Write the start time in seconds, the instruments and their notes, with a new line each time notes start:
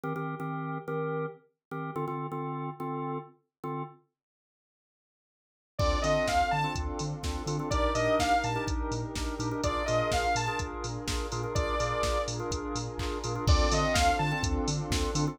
0.04 drawbar organ D#3 C4 G4 A#4
0.16 drawbar organ D#3 C4 G4 A#4
0.40 drawbar organ D#3 C4 G4 A#4
0.88 drawbar organ D#3 C4 G4 A#4
1.71 drawbar organ D#3 C4 G4 A#4
1.96 drawbar organ D3 C4 F4 A4
2.08 drawbar organ D3 C4 F4 A4
2.32 drawbar organ D3 C4 F4 A4
2.80 drawbar organ D3 C4 F4 A4
3.64 drawbar organ D3 C4 F4 A4
5.79 synth bass 2 D2, pad 2 (warm) C4 D4 F4 A4, drawbar organ C4 D4 F4 A4, lead 2 (sawtooth) D5, kick, crash
6.02 synth bass 2 D3, drawbar organ C4 D4 F4 A4, lead 2 (sawtooth) D#5, open hi-hat
6.28 synth bass 2 D2, lead 2 (sawtooth) F5, kick, snare
6.51 synth bass 2 D3, lead 2 (sawtooth) A5
6.64 drawbar organ C4 D4 F4 A4
6.75 synth bass 2 D2, kick, closed hi-hat
6.99 synth bass 2 D3, open hi-hat
7.23 synth bass 2 D2, drawbar organ C4 D4 F4 A4, kick, snare
7.46 synth bass 2 D3, drawbar organ C4 D4 F4 A4, open hi-hat
7.59 drawbar organ C4 D4 F4 A4
7.70 synth bass 2 A#1, drawbar organ D4 D#4 G4 A#4, pad 2 (warm) D4 D#4 G4 A#4, lead 2 (sawtooth) D5, kick, closed hi-hat
7.95 synth bass 2 A#2, drawbar organ D4 D#4 G4 A#4, lead 2 (sawtooth) D#5, open hi-hat
8.19 synth bass 2 A#1, lead 2 (sawtooth) F5, kick, snare
8.44 synth bass 2 A#2, lead 2 (sawtooth) A5, open hi-hat
8.56 drawbar organ D4 D#4 G4 A#4
8.68 synth bass 2 A#1, kick, closed hi-hat
8.91 synth bass 2 A#2, open hi-hat
9.15 synth bass 2 A#1, drawbar organ D4 D#4 G4 A#4, kick, snare
9.39 synth bass 2 A#2, drawbar organ D4 D#4 G4 A#4, open hi-hat
9.51 drawbar organ D4 D#4 G4 A#4
9.63 synth bass 2 A#1, drawbar organ D4 F4 G#4 A#4, pad 2 (warm) D4 F4 G#4 A#4, lead 2 (sawtooth) D5, kick, closed hi-hat
9.86 synth bass 2 A#2, drawbar organ D4 F4 G#4 A#4, lead 2 (sawtooth) D#5, open hi-hat
10.12 synth bass 2 A#1, lead 2 (sawtooth) F5, kick, snare
10.35 synth bass 2 A#2, lead 2 (sawtooth) A5, open hi-hat
10.48 drawbar organ D4 F4 G#4 A#4
10.59 synth bass 2 A#1, kick, closed hi-hat
10.84 synth bass 2 A#2, open hi-hat
11.08 synth bass 2 A#1, drawbar organ D4 F4 G#4 A#4, kick, snare
11.32 synth bass 2 A#2, drawbar organ D4 F4 G#4 A#4, open hi-hat
11.44 drawbar organ D4 F4 G#4 A#4
11.55 synth bass 2 A#1, pad 2 (warm) D4 F4 G#4 A#4, drawbar organ D4 F4 G#4 A#4, lead 2 (sawtooth) D5, kick, closed hi-hat
11.80 synth bass 2 A#2, drawbar organ D4 F4 G#4 A#4, open hi-hat
12.03 synth bass 2 A#1, kick, snare
12.28 synth bass 2 A#2, open hi-hat
12.40 drawbar organ D4 F4 G#4 A#4
12.50 synth bass 2 A#1, kick, closed hi-hat
12.75 synth bass 2 A#2, open hi-hat
12.98 synth bass 2 A#1, drawbar organ D4 F4 G#4 A#4, kick, clap
13.24 synth bass 2 A#2, drawbar organ D4 F4 G#4 A#4, open hi-hat
13.36 drawbar organ D4 F4 G#4 A#4
13.47 synth bass 2 D2, pad 2 (warm) C4 D4 F4 A4, drawbar organ C4 D4 F4 A4, lead 2 (sawtooth) D5, kick, crash
13.71 synth bass 2 D3, drawbar organ C4 D4 F4 A4, lead 2 (sawtooth) D#5, open hi-hat
13.94 synth bass 2 D2, lead 2 (sawtooth) F5, kick, snare
14.19 synth bass 2 D3, lead 2 (sawtooth) A5
14.32 drawbar organ C4 D4 F4 A4
14.43 synth bass 2 D2, kick, closed hi-hat
14.68 synth bass 2 D3, open hi-hat
14.90 synth bass 2 D2, drawbar organ C4 D4 F4 A4, kick, snare
15.15 synth bass 2 D3, drawbar organ C4 D4 F4 A4, open hi-hat
15.27 drawbar organ C4 D4 F4 A4